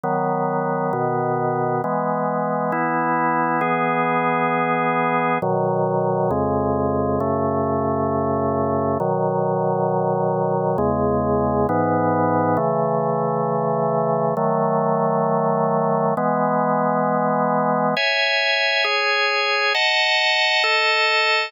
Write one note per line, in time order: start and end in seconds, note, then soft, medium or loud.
0.04 0.92 D#3 medium
0.04 0.92 F#3 medium
0.04 0.92 B3 medium
0.93 1.82 B2 medium
0.93 1.82 D#3 medium
0.93 1.82 B3 medium
1.84 2.72 E3 medium
1.84 2.73 G#3 medium
1.84 2.72 B3 medium
2.72 3.61 E3 medium
2.72 3.61 B3 medium
2.72 3.61 E4 medium
3.61 5.38 E3 medium
3.61 5.38 B3 medium
3.61 5.38 G#4 medium
5.42 6.31 B2 medium
5.42 6.31 D#3 medium
5.42 6.31 F#3 medium
6.31 7.19 F2 medium
6.31 7.19 C#3 medium
6.31 7.19 G#3 medium
7.20 8.98 F#2 medium
7.20 8.98 C#3 medium
7.20 8.98 A3 medium
9.00 10.77 B2 medium
9.00 10.77 D#3 medium
9.00 10.77 F#3 medium
10.78 11.67 E2 medium
10.78 11.67 C#3 medium
10.78 11.67 G#3 medium
11.69 12.58 G#2 medium
11.69 12.56 E3 loud
11.69 12.58 B3 medium
12.57 14.34 C#3 medium
12.57 14.34 E3 medium
12.57 14.34 A3 medium
14.37 16.14 D#3 medium
14.37 16.14 F#3 medium
14.37 16.14 A3 medium
16.17 17.94 E3 medium
16.17 17.94 G#3 medium
16.17 17.94 B3 medium
17.97 18.84 C#5 medium
17.97 18.85 E5 medium
17.97 18.84 G#5 medium
18.84 19.73 G#4 medium
18.84 19.73 C#5 medium
18.84 19.73 G#5 medium
19.74 20.63 D#5 medium
19.74 20.63 F#5 medium
19.74 20.63 A5 medium
20.64 21.52 A4 medium
20.64 21.52 D#5 medium
20.64 21.52 A5 medium